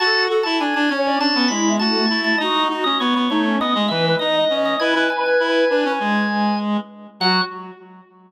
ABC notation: X:1
M:4/4
L:1/16
Q:1/4=100
K:F#m
V:1 name="Drawbar Organ"
a2 z a g g g2 a2 b2 a3 a | ^d2 z d c c c2 d2 e2 d3 d | g2 g g9 z4 | f4 z12 |]
V:2 name="Ocarina"
A2 A z3 c d C2 E2 A,4 | F2 F z3 ^D C ^d2 B2 d4 | B8 z8 | F4 z12 |]
V:3 name="Clarinet"
F2 F E D D C2 D B, G,2 F2 E2 | ^D2 D C B, B, A,2 B, G, E,2 D2 C2 | E E z2 E2 D C G,6 z2 | F,4 z12 |]